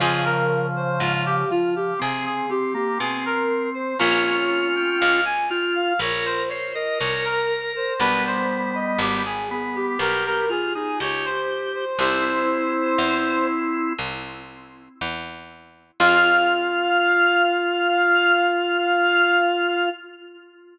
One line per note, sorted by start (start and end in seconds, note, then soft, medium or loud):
0.00 0.91 F2 loud
0.00 1.44 C#3 loud
0.00 1.44 F3 loud
0.00 3.92 C4 medium
0.00 3.92 F4 medium
0.00 0.24 G#4 loud
0.00 3.92 G#4 medium
0.25 0.66 A#4 medium
0.76 1.00 C5 medium
1.00 1.90 G#2 medium
1.00 1.24 F4 medium
1.26 1.49 G4 medium
1.50 1.94 F3 medium
1.50 1.74 F4 medium
1.76 1.99 G4 medium
1.99 2.92 C3 medium
1.99 2.46 C4 medium
1.99 2.25 G#4 medium
2.25 2.49 G#4 medium
2.50 2.73 C4 medium
2.50 2.74 G4 medium
2.74 2.98 A#3 loud
2.74 2.98 G4 medium
2.99 3.90 B2 medium
2.99 3.94 C4 medium
2.99 3.24 G#4 medium
3.25 3.69 A#4 medium
3.74 3.98 C5 medium
3.99 4.91 A#1 loud
3.99 7.91 A#3 medium
3.99 7.91 C#4 medium
3.99 5.20 C#4 medium
3.99 7.91 F4 medium
3.99 5.20 F4 loud
3.99 4.23 C#5 loud
4.25 4.67 C#5 medium
4.75 4.99 G5 loud
5.00 5.92 C#2 loud
5.00 5.24 F5 medium
5.25 5.49 G#5 medium
5.50 5.93 F4 loud
5.50 5.74 G5 medium
5.75 5.99 F5 medium
5.99 6.89 A#1 medium
5.99 6.43 A#4 medium
5.99 6.25 C#5 medium
6.25 6.49 C5 medium
6.49 6.75 C5 loud
6.49 6.72 C#5 medium
6.74 6.99 A#4 medium
6.74 6.98 D#5 medium
6.99 7.91 C2 medium
6.99 7.93 A#4 medium
6.99 7.24 C#5 medium
7.24 7.72 A#4 medium
7.76 7.99 C5 medium
8.00 8.90 B1 loud
8.00 9.22 G3 medium
8.00 9.22 B3 loud
8.00 11.93 B3 medium
8.00 11.93 D4 medium
8.00 11.93 G4 medium
8.00 8.24 B4 loud
8.26 8.75 C5 medium
8.75 8.99 D#5 medium
8.99 9.89 G#1 loud
8.99 9.24 G4 medium
9.25 9.49 G#4 medium
9.51 9.97 B3 medium
9.51 9.75 G#4 medium
9.75 9.99 G4 medium
9.99 10.89 B1 loud
9.99 10.45 G4 medium
9.99 10.24 A#4 medium
10.26 10.49 A#4 medium
10.49 10.73 F4 medium
10.49 10.74 G#4 medium
10.75 10.99 D#4 medium
10.75 10.99 G#4 medium
11.00 11.90 C#2 medium
11.00 11.85 G4 medium
11.00 11.25 C#5 medium
11.25 11.71 C5 medium
11.74 11.98 C5 medium
11.99 12.89 C2 loud
11.99 13.93 C4 medium
11.99 15.92 C4 medium
11.99 13.93 E4 loud
11.99 15.92 E4 medium
11.99 15.92 G4 medium
11.99 13.46 C5 loud
12.98 13.88 E2 loud
13.99 14.89 C2 medium
15.01 15.91 E2 medium
16.00 19.88 F2 loud
16.00 19.88 C4 loud
16.00 19.88 F4 medium
16.00 19.89 F4 loud
16.00 19.88 G#4 loud
16.00 19.89 F5 loud